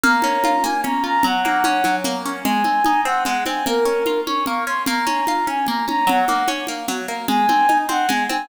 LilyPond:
<<
  \new Staff \with { instrumentName = "Flute" } { \time 3/4 \key aes \mixolydian \tempo 4 = 149 bes''4. aes''8 bes''8 bes''8 | ges''2 r4 | aes''4. ges''8 ges''8 aes''8 | bes'4. des'''8 des'''8 c'''8 |
bes''4. aes''8 bes''8 bes''8 | ges''4 r2 | aes''4. ges''8 aes''8 aes''8 | }
  \new Staff \with { instrumentName = "Acoustic Guitar (steel)" } { \time 3/4 \key aes \mixolydian bes8 des'8 f'8 bes8 des'8 f'8 | ges8 bes8 des'8 ges8 bes8 des'8 | aes8 c'8 ees'8 c'8 aes8 c'8 | bes8 des'8 f'8 des'8 bes8 des'8 |
bes8 des'8 f'8 des'8 bes8 des'8 | ges8 bes8 des'8 bes8 ges8 bes8 | aes8 c'8 ees'8 c'8 aes8 c'8 | }
  \new DrumStaff \with { instrumentName = "Drums" } \drummode { \time 3/4 cgl8 cgho8 cgho8 cgho8 cgl4 | cgl8 cgho8 cgho8 cgho8 cgl4 | cgl8 cgho8 cgho4 cgl8 cgho8 | cgl4 cgho8 cgho8 cgl4 |
cgl8 cgho8 cgho8 cgho8 cgl8 cgho8 | cgl8 cgho8 cgho8 cgho8 cgl4 | cgl8 cgho8 cgho8 cgho8 cgl8 cgho8 | }
>>